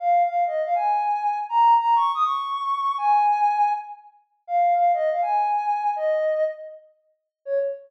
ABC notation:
X:1
M:4/4
L:1/16
Q:1/4=161
K:Db
V:1 name="Ocarina"
f3 f2 e2 f a8 | b3 b2 d'2 e' d'8 | a8 z8 | f3 f2 e2 f a8 |
e6 z10 | d4 z12 |]